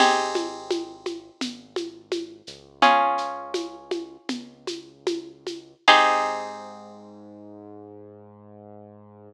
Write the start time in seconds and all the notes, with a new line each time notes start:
0.00 G#1 C4 D#4 G4 G#4, crash, low conga, shaker
0.35 high conga, shaker
0.71 high conga, shaker
1.06 high conga, shaker
1.41 G#1, low conga, shaker
1.76 high conga, shaker
2.12 high conga, shaker
2.47 C#2, shaker
2.82 C#4 F4 G#4, low conga, shaker
3.18 shaker
3.54 high conga, shaker
3.91 high conga, shaker
4.29 C#2, low conga, shaker
4.67 high conga, shaker
5.07 high conga, shaker
5.47 high conga, shaker
5.88 G#2 C4 D#4 G4 G#4, kick, crash